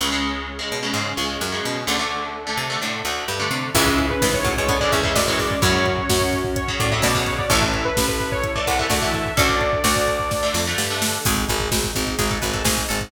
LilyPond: <<
  \new Staff \with { instrumentName = "Lead 2 (sawtooth)" } { \time 4/4 \key cis \phrygian \tempo 4 = 128 r1 | r1 | e''16 e''8 b'8 cis''8 cis''8 d''16 e''16 e''16 d''16 cis''16 d''8 | cis''2 cis''8 d''16 e''16 d''16 r16 cis''16 d''16 |
e''16 e''8 b'8 b'8 cis''8 d''16 fis''16 e''16 d''16 e''16 e''8 | d''2~ d''8 r4. | \key gis \phrygian r1 | }
  \new Staff \with { instrumentName = "Pizzicato Strings" } { \time 4/4 \key cis \phrygian r1 | r1 | <gis, e>4 <gis, e>8 <a, fis>16 <b, gis>16 <d b>16 r16 <e cis'>4 r8 | <e' cis''>4 r2 <cis' a'>4 |
<cis' a'>4 r2 <a fis'>4 | <cis' a'>4 <fis' d''>4 r2 | \key gis \phrygian gis'4 r4 gis'16 a'16 b'16 a'16 gis'8 a'8 | }
  \new Staff \with { instrumentName = "Overdriven Guitar" } { \time 4/4 \key cis \phrygian <cis gis>16 <cis gis>4 <cis gis>8 <cis gis>16 <cis gis>8 <cis gis>8. <cis gis>8. | <d a>16 <d a>4 <d a>8 <d a>16 <d a>8 <d a>8. <d a>8. | <cis e gis>2~ <cis e gis>16 <cis e gis>8 <cis e gis>8 <cis e gis>8. | <cis fis>2~ <cis fis>16 <cis fis>8 <cis fis>8 <cis fis>8. |
<e a>2~ <e a>16 <e a>8 <e a>8 <e a>8. | <d a>2~ <d a>16 <d a>8 <d a>8 <d a>8. | \key gis \phrygian r1 | }
  \new Staff \with { instrumentName = "Electric Bass (finger)" } { \clef bass \time 4/4 \key cis \phrygian cis,4. b,8 gis,8 cis,8 fis,8 b,8 | d,4. bis,8 a,8 d,8 g,8 bis,8 | cis,4 cis,4. e,8 fis,4 | fis,4 fis,4. a,8 b,4 |
a,,4 a,,4. bis,,8 d,4 | d,4 d,4. f,8 g,4 | \key gis \phrygian gis,,8 gis,,8 gis,,8 gis,,8 gis,,8 gis,,8 gis,,8 gis,,8 | }
  \new Staff \with { instrumentName = "Pad 5 (bowed)" } { \time 4/4 \key cis \phrygian <cis' gis'>1 | <d' a'>1 | <cis' e' gis'>2 <gis cis' gis'>2 | <cis' fis'>1 |
<e' a'>1 | <d' a'>1 | \key gis \phrygian <dis' gis'>1 | }
  \new DrumStaff \with { instrumentName = "Drums" } \drummode { \time 4/4 r4 r4 r4 r4 | r4 r4 r4 r4 | <cymc bd>16 bd16 <hh bd>16 bd16 <bd sn>16 bd16 <hh bd>16 bd16 <hh bd>16 bd16 <hh bd>16 bd16 <bd sn>16 bd16 <hho bd>16 bd16 | <hh bd>16 bd16 <hh bd>16 bd16 <bd sn>16 bd16 <hh bd>16 bd16 <hh bd>16 bd16 <hh bd>16 bd16 <bd sn>16 bd16 <hh bd>16 bd16 |
<hh bd>16 bd16 <hh bd>16 bd16 <bd sn>16 bd16 <hh bd>16 bd16 <hh bd>16 bd16 <hh bd>16 bd16 <bd sn>16 bd16 <hh bd>16 bd16 | <hh bd>16 bd16 <hh bd>16 bd16 <bd sn>16 bd16 <hh bd>16 bd16 <bd sn>8 sn8 sn8 sn8 | <cymc bd>16 <hh bd>16 <hh bd>16 <hh bd>16 <bd sn>16 <hh bd>16 <hh bd>16 <hh bd>16 <hh bd>16 <hh bd>16 <hh bd>16 <hh bd>16 <bd sn>16 <hh bd>16 hh16 <hh bd>16 | }
>>